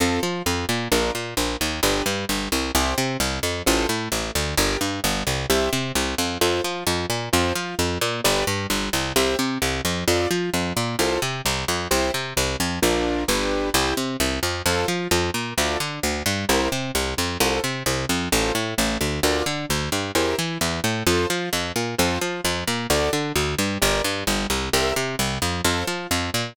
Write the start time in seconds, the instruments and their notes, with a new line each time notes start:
0.00 electric bass (finger) F2, acoustic grand piano C4 F4 A4
0.23 electric bass (finger) F3, acoustic grand piano F4
0.46 electric bass (finger) F2, acoustic grand piano F3
0.69 electric bass (finger) A#2, acoustic grand piano A#3
0.92 electric bass (finger) A#1, acoustic grand piano D4 F4 A#4
1.15 electric bass (finger) A#2, acoustic grand piano A#3
1.37 electric bass (finger) A#1, acoustic grand piano A#3
1.60 electric bass (finger) D#2, acoustic grand piano D#3
1.83 electric bass (finger) G1, acoustic grand piano D4 G4 B4
2.06 electric bass (finger) G2, acoustic grand piano G3
2.29 electric bass (finger) G1, acoustic grand piano G3
2.52 electric bass (finger) C2, acoustic grand piano C3
2.75 electric bass (finger) C2, acoustic grand piano E4 G4 C5
2.98 electric bass (finger) C3, acoustic grand piano C4
3.20 electric bass (finger) C2, acoustic grand piano C3
3.43 electric bass (finger) F2, acoustic grand piano F3
3.66 electric bass (finger) A1, acoustic grand piano F4 A4 C5
3.89 electric bass (finger) A2, acoustic grand piano A3
4.12 electric bass (finger) A1, acoustic grand piano A3
4.35 electric bass (finger) D2, acoustic grand piano D3
4.57 electric bass (finger) G1, acoustic grand piano G4 A#4 D5
4.81 electric bass (finger) G2, acoustic grand piano G3
5.04 electric bass (finger) G1, acoustic grand piano G3
5.27 electric bass (finger) C2, acoustic grand piano C3
5.50 electric bass (finger) C2, acoustic grand piano G4 C5 E5
5.73 electric bass (finger) C3, acoustic grand piano C4
5.95 electric bass (finger) C2, acoustic grand piano C3
6.18 electric bass (finger) F2, acoustic grand piano F3
6.41 electric bass (finger) F2, acoustic grand piano F4 A4 C5
6.64 electric bass (finger) F3, acoustic grand piano F4
6.87 electric bass (finger) F2, acoustic grand piano F3
7.10 electric bass (finger) A#2, acoustic grand piano A#3
7.33 electric bass (finger) F2, acoustic grand piano F4 A4 C5
7.55 electric bass (finger) F3, acoustic grand piano F4
7.79 electric bass (finger) F2, acoustic grand piano F3
8.01 electric bass (finger) A#2, acoustic grand piano A#3
8.24 electric bass (finger) G1, acoustic grand piano G4 B4 D5
8.47 electric bass (finger) G2, acoustic grand piano G3
8.70 electric bass (finger) G1, acoustic grand piano G3
8.93 electric bass (finger) C2, acoustic grand piano C3
9.16 electric bass (finger) C2, acoustic grand piano G4 C5 E5
9.39 electric bass (finger) C3, acoustic grand piano C4
9.62 electric bass (finger) C2, acoustic grand piano C3
9.85 electric bass (finger) F2, acoustic grand piano F3
10.08 electric bass (finger) F2, acoustic grand piano F4 A4 D5
10.31 electric bass (finger) F3, acoustic grand piano F4
10.54 electric bass (finger) F2, acoustic grand piano F3
10.76 electric bass (finger) A#2, acoustic grand piano A#3
10.99 electric bass (finger) C2, acoustic grand piano F4 A4 C5
11.22 electric bass (finger) C3, acoustic grand piano C4
11.45 electric bass (finger) C2, acoustic grand piano C3
11.68 electric bass (finger) F2, acoustic grand piano F3
11.91 electric bass (finger) C2, acoustic grand piano E4 G4 C5
12.14 electric bass (finger) C3, acoustic grand piano C4
12.37 electric bass (finger) C2, acoustic grand piano C3
12.60 electric bass (finger) F2, acoustic grand piano F3
12.82 electric bass (finger) A#1, acoustic grand piano D4 F4 A#4
13.28 electric bass (finger) G1, acoustic grand piano D4 G4 B4
13.74 electric bass (finger) C2, acoustic grand piano E4 G4 C5
13.97 electric bass (finger) C3, acoustic grand piano C4
14.20 electric bass (finger) C2, acoustic grand piano C3
14.43 electric bass (finger) F2, acoustic grand piano F3
14.66 electric bass (finger) F2, acoustic grand piano F4 A4 C5
14.88 electric bass (finger) F3, acoustic grand piano F4
15.11 electric bass (finger) F2, acoustic grand piano F3
15.34 electric bass (finger) A#2, acoustic grand piano A#3
15.57 electric bass (finger) D2, acoustic grand piano F4 A4 D5
15.80 electric bass (finger) D3, acoustic grand piano D4
16.03 electric bass (finger) D2, acoustic grand piano D3
16.26 electric bass (finger) G2, acoustic grand piano G3
16.49 electric bass (finger) C2, acoustic grand piano E4 G4 A#4 C5
16.72 electric bass (finger) C3, acoustic grand piano C4
16.95 electric bass (finger) C2, acoustic grand piano C3
17.17 electric bass (finger) F2, acoustic grand piano F3
17.40 electric bass (finger) C2, acoustic grand piano F4 A4 C5
17.63 electric bass (finger) C3, acoustic grand piano C4
17.86 electric bass (finger) C2, acoustic grand piano C3
18.09 electric bass (finger) F2, acoustic grand piano F3
18.32 electric bass (finger) A1, acoustic grand piano F4 A4 C5
18.55 electric bass (finger) A2, acoustic grand piano A3
18.78 electric bass (finger) A1, acoustic grand piano A3
19.01 electric bass (finger) D2, acoustic grand piano D3
19.23 electric bass (finger) D2, acoustic grand piano F4 A#4 D5
19.46 electric bass (finger) D3, acoustic grand piano D4
19.69 electric bass (finger) D2, acoustic grand piano D3
19.92 electric bass (finger) G2, acoustic grand piano G3
20.15 electric bass (finger) E2, acoustic grand piano E4 G4 A#4 C5
20.38 electric bass (finger) E3, acoustic grand piano E4
20.61 electric bass (finger) E2, acoustic grand piano E3
20.84 electric bass (finger) A2, acoustic grand piano A3
21.07 electric bass (finger) F2, acoustic grand piano F4 A4 C5
21.30 electric bass (finger) F3, acoustic grand piano F4
21.52 electric bass (finger) F2, acoustic grand piano F3
21.76 electric bass (finger) A#2, acoustic grand piano A#3
21.98 electric bass (finger) F2, acoustic grand piano F4 A4 C5
22.21 electric bass (finger) F3, acoustic grand piano F4
22.44 electric bass (finger) F2, acoustic grand piano F3
22.67 electric bass (finger) A#2, acoustic grand piano A#3
22.90 electric bass (finger) D2, acoustic grand piano F#4 A4 D5
23.13 electric bass (finger) D3, acoustic grand piano D4
23.35 electric bass (finger) D2, acoustic grand piano D3
23.58 electric bass (finger) G2, acoustic grand piano G3
23.82 electric bass (finger) G1, acoustic grand piano G4 A#4 D5
24.04 electric bass (finger) G2, acoustic grand piano G3
24.27 electric bass (finger) G1, acoustic grand piano G3
24.50 electric bass (finger) C2, acoustic grand piano C3
24.73 electric bass (finger) C2, acoustic grand piano G4 A#4 C5 E5
24.96 electric bass (finger) C3, acoustic grand piano C4
25.19 electric bass (finger) C2, acoustic grand piano C3
25.42 electric bass (finger) F2, acoustic grand piano F3
25.65 electric bass (finger) F2, acoustic grand piano F4 A4 C5
25.87 electric bass (finger) F3, acoustic grand piano F4
26.11 electric bass (finger) F2, acoustic grand piano F3
26.34 electric bass (finger) A#2, acoustic grand piano A#3